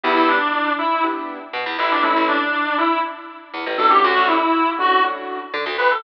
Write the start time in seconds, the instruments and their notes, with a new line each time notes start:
0.03 electric bass (finger) E2, acoustic grand piano B3 D4 E4 G4, clarinet E4
0.16 electric bass (finger) E2
0.28 clarinet D4
0.79 clarinet E4
1.03 acoustic grand piano B3 D4 E4 G4
1.53 electric bass (finger) B2
1.66 electric bass (finger) E2
1.79 electric bass (finger) A1, clarinet E4
1.91 clarinet D4
2.02 acoustic grand piano A3 C#4 E4, clarinet E4
2.16 electric bass (finger) A1
2.28 clarinet D4
2.78 clarinet E4
3.54 electric bass (finger) E2
3.66 electric bass (finger) A1
3.78 electric bass (finger) A1, acoustic grand piano A3 C#4 D4 F#4, clarinet A4
3.89 clarinet G4
4.03 electric bass (finger) D2, clarinet F#4
4.17 electric bass (finger) D2
4.27 clarinet E4
4.79 acoustic grand piano A3 C#4 D4 F#4, clarinet F#4
5.04 acoustic grand piano A3 C#4 D4 F#4
5.54 electric bass (finger) D3
5.66 electric bass (finger) D2
5.78 electric bass (finger) D2, clarinet B4
5.91 clarinet A4